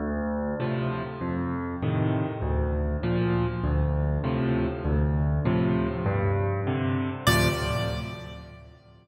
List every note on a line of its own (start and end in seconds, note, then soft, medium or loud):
0.00 0.55 D2 loud
0.60 1.02 A2 medium
0.60 1.02 C3 medium
0.60 1.02 F3 medium
1.21 1.76 F2 medium
1.82 2.25 A2 medium
1.82 2.25 C3 medium
1.82 2.25 D#3 medium
2.42 2.97 D2 medium
3.03 3.46 A#2 medium
3.03 3.46 F3 medium
3.64 4.18 D2 medium
4.24 4.66 A2 medium
4.24 4.66 C3 medium
4.24 4.66 F3 medium
4.85 5.39 D2 loud
5.45 5.88 A2 medium
5.45 5.88 C3 medium
5.45 5.88 F3 medium
6.06 6.60 G2 loud
6.67 7.09 C3 medium
6.67 7.09 D3 medium
7.27 7.49 D2 loud
7.27 7.49 A2 loud
7.27 7.49 C3 medium
7.27 7.49 F3 loud
7.27 7.48 D5 loud